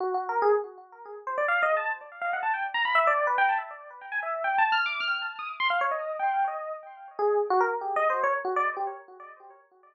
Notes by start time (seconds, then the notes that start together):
0.00 F#4
0.14 F#4
0.29 A#4
0.42 G#4
1.27 C5
1.38 D5
1.48 F5
1.62 D#5
1.77 A5
2.21 F5
2.33 F#5
2.43 A5
2.54 G5
2.74 A#5
2.85 B5
2.95 E5
3.07 D5
3.27 B4
3.38 G5
3.49 A5
4.12 G#5
4.23 E5
4.44 G5
4.58 A5
4.72 F6
4.86 D6
5.00 F6
5.14 F6
5.39 D#6
5.60 C6
5.70 F5
5.81 C#5
5.91 D#5
6.19 G5
6.48 D#5
7.19 G#4
7.50 F#4
7.60 A#4
7.81 G4
7.96 D#5
8.10 C5
8.23 C#5
8.45 F#4
8.56 D5
8.77 G4